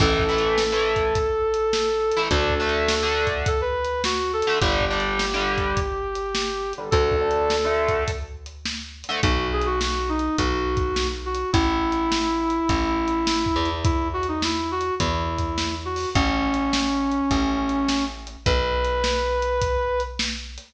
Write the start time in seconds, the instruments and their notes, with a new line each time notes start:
0.00 electric bass (finger) A1, overdriven guitar E3 A3, brass section A4, kick, crash
0.19 kick
0.29 overdriven guitar E3 A3
0.38 closed hi-hat
0.58 snare
0.72 overdriven guitar E3 A3
0.96 kick, closed hi-hat
1.15 kick, closed hi-hat
1.54 closed hi-hat
1.73 snare
2.12 closed hi-hat
2.17 overdriven guitar E3 A3
2.31 electric bass (finger) D2, overdriven guitar D3 A3, brass section A4, kick, closed hi-hat
2.50 kick
2.60 overdriven guitar D3 A3
2.69 closed hi-hat
2.88 snare
3.03 overdriven guitar D3 A3
3.27 kick, closed hi-hat
3.46 brass section A4, kick, closed hi-hat
3.61 brass section B4
3.85 closed hi-hat
4.04 brass section F#4, snare
4.33 brass section A4
4.42 closed hi-hat
4.47 overdriven guitar D3 A3
4.60 electric bass (finger) G1, overdriven guitar D3 G3, brass section G4, kick, closed hi-hat
4.81 kick
4.91 overdriven guitar D3 G3
5.00 closed hi-hat
5.19 snare
5.34 overdriven guitar D3 G3
5.58 kick, closed hi-hat
5.77 kick, closed hi-hat
6.15 closed hi-hat
6.35 snare
6.73 closed hi-hat
6.78 overdriven guitar D3 G3
6.91 electric bass (finger) D2, overdriven guitar D3 A3, brass section A4, kick, closed hi-hat
7.12 kick
7.21 overdriven guitar D3 A3
7.31 closed hi-hat
7.50 snare
7.65 overdriven guitar D3 A3
7.88 kick, closed hi-hat
8.08 kick, closed hi-hat
8.46 closed hi-hat
8.65 snare
9.04 closed hi-hat
9.09 overdriven guitar D3 A3
9.23 electric bass (finger) B1, brass section F#4, kick, closed hi-hat
9.53 brass section G#4
9.62 closed hi-hat
9.66 brass section F#4
9.81 brass section F#4, snare
10.09 brass section D#4
10.19 closed hi-hat
10.38 electric bass (finger) B1, brass section F#4, kick, closed hi-hat
10.77 kick, closed hi-hat
10.96 snare
11.25 brass section F#4
11.35 closed hi-hat
11.53 electric bass (finger) A1, brass section E4, kick, closed hi-hat
11.92 closed hi-hat
12.12 snare
12.50 closed hi-hat
12.69 electric bass (finger) A1, kick, closed hi-hat
13.08 closed hi-hat
13.27 snare
13.46 kick
13.56 electric bass (finger) E2
13.65 closed hi-hat
13.84 brass section E4, kick, closed hi-hat
14.13 brass section F#4
14.23 closed hi-hat
14.28 brass section D#4
14.42 brass section E4, snare
14.71 brass section F#4
14.81 closed hi-hat
15.00 electric bass (finger) E2, brass section E4, kick, closed hi-hat
15.38 kick, closed hi-hat
15.58 snare
15.85 brass section F#4
15.96 open hi-hat
16.15 electric bass (finger) A1, brass section C#4, kick, closed hi-hat
16.54 closed hi-hat
16.73 snare
17.12 closed hi-hat
17.31 electric bass (finger) A1, kick, closed hi-hat
17.69 closed hi-hat
17.88 snare
18.27 closed hi-hat
18.46 electric bass (finger) B1, brass section B4, kick, closed hi-hat
18.84 closed hi-hat
19.04 snare
19.42 closed hi-hat
19.62 kick, closed hi-hat
20.00 closed hi-hat
20.19 snare
20.58 closed hi-hat